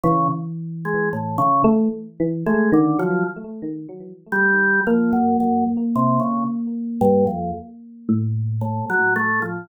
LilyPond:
<<
  \new Staff \with { instrumentName = "Drawbar Organ" } { \time 9/8 \tempo 4. = 37 des16 r8 aes16 a,16 des16 r8. aes16 d16 f16 r4 g8 | f16 ges,16 ges,16 r16 c16 des16 r8 g,16 f,16 r4 a,16 ges16 a16 f16 | }
  \new Staff \with { instrumentName = "Electric Piano 1" } { \time 9/8 e4. a16 r16 e16 a16 ees16 ges16 r4. | bes2~ bes8 r8 a,8. r8. | }
>>